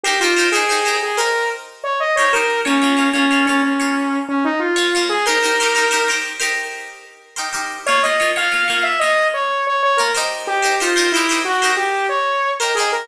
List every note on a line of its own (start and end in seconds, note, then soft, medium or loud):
0.04 0.17 D#4 loud
0.04 0.19 G4 medium
0.04 0.17 G4 loud
0.04 0.17 A#4 loud
0.04 0.17 C5 loud
0.20 0.34 D#4 medium
0.20 0.48 F4 medium
0.20 0.34 G4 medium
0.20 0.34 A#4 medium
0.20 0.34 C5 medium
0.36 0.49 D#4 medium
0.36 0.49 G4 medium
0.36 0.49 A#4 medium
0.36 0.49 C5 loud
0.52 0.66 D#4 medium
0.52 0.66 G4 medium
0.52 0.96 G#4 medium
0.52 0.66 A#4 medium
0.52 0.66 C5 medium
0.69 0.82 D#4 medium
0.69 0.82 G4 medium
0.69 0.82 A#4 medium
0.69 0.82 C5 medium
0.85 1.11 D#4 medium
0.85 1.11 G4 medium
0.85 1.11 A#4 medium
0.85 1.11 C5 medium
1.03 1.18 G#4 medium
1.17 1.69 D#4 loud
1.17 1.69 G4 medium
1.17 1.49 A#4 medium
1.17 1.69 A#4 loud
1.17 1.69 C5 medium
1.84 1.99 C#5 medium
2.00 2.15 D#5 medium
2.16 2.30 G4 medium
2.16 2.30 A#4 medium
2.16 2.30 C5 loud
2.16 2.31 C#5 medium
2.20 2.30 D#4 medium
2.33 2.59 D#4 loud
2.33 2.59 G4 medium
2.33 2.60 A#4 medium
2.33 2.59 A#4 medium
2.33 2.59 C5 medium
2.65 2.78 A#3 loud
2.65 3.08 C#4 medium
2.65 2.78 F4 medium
2.65 2.78 C#5 loud
2.82 2.95 A#3 medium
2.82 2.95 F4 medium
2.82 2.95 C#5 medium
2.97 3.10 A#3 medium
2.97 3.10 F4 loud
2.97 3.10 C#5 medium
3.13 3.26 A#3 loud
3.13 3.45 C#4 medium
3.13 3.26 F4 medium
3.13 3.26 C#5 loud
3.31 3.44 A#3 medium
3.31 3.44 F4 loud
3.31 3.44 C#5 medium
3.46 3.73 A#3 medium
3.46 3.61 C#4 medium
3.46 3.73 F4 medium
3.46 3.73 C#5 medium
3.63 4.19 C#4 medium
3.80 4.32 A#3 medium
3.80 4.32 F4 medium
3.80 4.32 C#5 loud
4.29 4.44 C#4 medium
4.44 4.60 D#4 medium
4.60 5.05 F4 medium
4.76 4.89 A#3 loud
4.76 4.89 F4 medium
4.76 4.89 C#5 loud
4.95 5.21 A#3 medium
4.95 5.21 F4 loud
4.95 5.21 C#5 medium
5.09 5.25 G#4 medium
5.26 5.39 D#4 loud
5.26 5.39 G4 loud
5.26 6.09 A#4 medium
5.26 5.39 A#4 loud
5.26 5.39 C5 loud
5.43 5.56 D#4 medium
5.43 5.56 G4 medium
5.43 5.56 A#4 medium
5.43 5.56 C5 medium
5.60 5.73 D#4 medium
5.60 5.73 G4 medium
5.60 5.73 A#4 loud
5.60 5.73 C5 loud
5.75 5.88 D#4 medium
5.75 5.88 G4 medium
5.75 5.88 A#4 medium
5.75 5.88 C5 medium
5.91 6.04 D#4 medium
5.91 6.04 G4 medium
5.91 6.04 A#4 medium
5.91 6.04 C5 loud
6.08 6.34 D#4 medium
6.08 6.34 G4 loud
6.08 6.34 A#4 medium
6.08 6.34 C5 medium
6.40 6.92 D#4 loud
6.40 6.92 G4 medium
6.40 6.92 A#4 loud
6.40 6.92 C5 medium
7.36 7.49 D#4 medium
7.36 7.49 G4 medium
7.36 7.49 A#4 medium
7.36 7.49 C5 medium
7.53 7.79 D#4 medium
7.53 7.79 G4 loud
7.53 7.79 A#4 loud
7.53 7.79 C5 medium
7.86 8.00 A#3 loud
7.86 8.00 F4 loud
7.86 8.02 C#5 medium
7.86 8.00 C#5 loud
8.03 8.17 A#3 medium
8.03 8.17 F4 medium
8.03 8.17 C#5 medium
8.03 8.31 D#5 medium
8.20 8.33 A#3 loud
8.20 8.33 F4 medium
8.20 8.33 C#5 loud
8.36 8.49 A#3 medium
8.36 8.49 F4 medium
8.36 8.49 C#5 loud
8.36 8.84 F5 medium
8.52 8.65 A#3 medium
8.52 8.65 F4 medium
8.52 8.65 C#5 medium
8.68 8.94 A#3 loud
8.68 8.94 F4 medium
8.68 8.94 C#5 loud
8.83 8.99 E5 medium
8.99 9.54 A#3 medium
8.99 9.54 F4 medium
8.99 9.54 C#5 medium
8.99 9.28 D#5 medium
9.34 9.65 C#5 medium
9.67 9.82 C#5 medium
9.83 9.98 C#5 medium
9.97 10.11 A#3 loud
9.97 10.11 F4 loud
9.97 10.13 A#4 medium
9.97 10.11 C#5 medium
10.15 10.60 D#4 loud
10.15 10.60 G4 loud
10.15 10.60 A#4 loud
10.15 10.60 C5 loud
10.47 10.75 G4 medium
10.62 10.75 D#4 medium
10.62 10.75 G4 medium
10.62 10.75 A#4 medium
10.62 10.75 C5 medium
10.80 10.93 D#4 loud
10.80 11.11 F4 medium
10.80 10.93 G4 loud
10.80 10.93 A#4 loud
10.80 10.93 C5 medium
10.96 11.09 D#4 medium
10.96 11.09 G4 loud
10.96 11.09 A#4 loud
10.96 11.09 C5 medium
11.12 11.39 E4 medium
11.12 11.27 G4 loud
11.12 11.27 A#4 medium
11.12 11.27 C5 medium
11.17 11.27 D#4 loud
11.29 11.55 D#4 medium
11.29 11.55 G4 medium
11.29 11.55 A#4 medium
11.29 11.55 C5 loud
11.45 11.71 F#4 medium
11.62 12.14 D#4 medium
11.62 12.14 G4 medium
11.62 12.14 A#4 loud
11.62 12.14 C5 loud
11.76 12.07 G4 medium
12.09 12.51 C#5 medium
12.60 12.73 D#4 medium
12.60 12.73 G4 medium
12.60 12.75 A#4 medium
12.60 12.73 A#4 medium
12.60 12.73 C5 loud
12.75 13.03 G4 medium
12.75 12.90 G#4 medium
12.75 13.03 A#4 medium
12.75 13.03 C5 medium
12.80 13.03 D#4 loud
12.92 13.08 A#4 medium